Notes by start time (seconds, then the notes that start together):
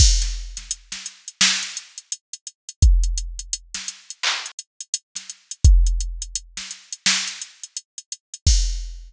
0.00 kick, crash
0.22 snare, closed hi-hat
0.57 snare, closed hi-hat
0.71 closed hi-hat
0.92 snare, closed hi-hat
1.06 closed hi-hat
1.28 closed hi-hat
1.41 snare
1.63 closed hi-hat
1.77 closed hi-hat
1.98 closed hi-hat
2.12 closed hi-hat
2.33 closed hi-hat
2.47 closed hi-hat
2.69 closed hi-hat
2.82 kick, closed hi-hat
3.04 closed hi-hat
3.18 closed hi-hat
3.39 closed hi-hat
3.53 closed hi-hat
3.74 snare, closed hi-hat
3.88 closed hi-hat
4.10 closed hi-hat
4.23 clap
4.46 closed hi-hat
4.59 closed hi-hat
4.81 closed hi-hat
4.94 closed hi-hat
5.15 snare, closed hi-hat
5.30 closed hi-hat
5.51 closed hi-hat
5.65 kick, closed hi-hat
5.86 closed hi-hat
6.01 closed hi-hat
6.22 closed hi-hat
6.35 closed hi-hat
6.57 snare, closed hi-hat
6.71 closed hi-hat
6.92 closed hi-hat
7.06 snare
7.27 closed hi-hat
7.42 closed hi-hat
7.64 closed hi-hat
7.77 closed hi-hat
7.98 closed hi-hat
8.12 closed hi-hat
8.34 closed hi-hat
8.47 kick, crash